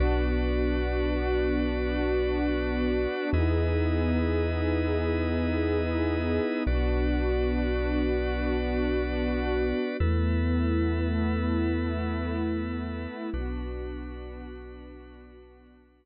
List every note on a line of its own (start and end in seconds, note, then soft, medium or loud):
0.00 3.07 B1 loud
0.00 3.30 B3 medium
0.00 3.30 D4 loud
0.00 3.30 F#4 medium
0.00 3.30 B4 medium
0.00 3.30 D5 medium
3.33 6.39 E2 loud
3.33 6.63 B3 medium
3.33 6.63 D#4 medium
3.33 6.63 E4 medium
3.33 6.63 G#4 medium
3.33 6.63 B4 medium
3.33 6.63 D#5 medium
6.67 9.73 B1 loud
6.67 9.97 B3 medium
6.67 9.97 D4 medium
6.67 9.97 F#4 medium
6.67 9.97 B4 medium
6.67 9.97 D5 medium
10.00 13.07 E2 loud
10.00 13.30 A3 medium
10.00 13.30 B3 medium
10.00 13.30 E4 medium
10.00 13.30 A4 medium
10.00 13.30 B4 medium
13.33 16.05 B1 loud
13.33 16.05 B3 loud
13.33 16.05 D4 medium
13.33 16.05 F#4 medium
13.33 16.05 B4 medium